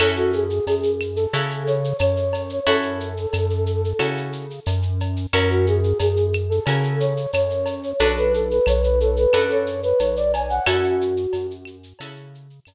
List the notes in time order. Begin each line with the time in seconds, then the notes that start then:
0.00 F#2 C#4 E4 F#4 A4, cowbell, claves, shaker
0.16 F#4, shaker
0.33 G#4, shaker
0.50 shaker
0.67 F#2 G#4, tambourine, cowbell, shaker
0.83 shaker
1.01 claves, shaker
1.16 A4, shaker
1.33 C#3 C#4 E4 F#4 A4, cowbell, shaker
1.50 shaker
1.67 C#5, shaker
1.84 shaker
1.99 F#2 C#5, tambourine, cowbell, claves, shaker
2.17 shaker
2.33 cowbell, shaker
2.49 shaker
2.67 F#2 C#4 E4 F#4 A4, cowbell, shaker
2.83 shaker
3.00 shaker
3.17 shaker
3.33 F#2, tambourine, cowbell, claves, shaker
3.50 shaker
3.66 shaker
3.84 shaker
3.99 C#3 C#4 E4 F#4 A4, cowbell, claves, shaker
4.17 shaker
4.33 shaker
4.50 shaker
4.66 F#2, tambourine, cowbell, shaker
4.82 shaker
5.00 cowbell, shaker
5.16 shaker
5.33 F#2 C#4 E4 F#4 A#4, cowbell, claves, shaker
5.50 F#4, shaker
5.67 G#4, shaker
5.83 shaker
5.99 F#2 G#4, tambourine, cowbell, shaker
6.17 shaker
6.33 claves, shaker
6.49 A4, shaker
6.66 C#3 C#4 E4 F#4 A#4, cowbell, shaker
6.83 shaker
7.00 C#5, shaker
7.17 shaker
7.33 F#2 C#5, tambourine, cowbell, claves, shaker
7.50 shaker
7.66 cowbell, shaker
7.83 shaker
7.99 B1 D4 F#4 A4 B4, cowbell, shaker
8.16 B4, shaker
8.33 A4, shaker
8.51 B4, shaker
8.66 B1 C#5, tambourine, cowbell, claves, shaker
8.83 B4, shaker
9.00 A4, shaker
9.16 B4, shaker
9.33 F#2 D4 F#4 A4 B4, cowbell, claves, shaker
9.50 C#5, shaker
9.66 shaker
9.83 B4, shaker
9.99 B1 C#5, tambourine, cowbell, shaker
10.16 D5, shaker
10.33 G#5, cowbell, shaker
10.50 F#5, shaker
10.66 F#2 C#4 E4 F#4 A4, cowbell, claves, shaker
10.84 shaker
11.01 shaker
11.17 shaker
11.33 F#2, tambourine, cowbell, shaker
11.51 shaker
11.65 claves, shaker
11.83 shaker
11.99 C#3 C#4 E4 F#4 A4, cowbell, shaker
12.16 shaker
12.34 shaker
12.50 shaker
12.65 F#2, tambourine, cowbell, claves, shaker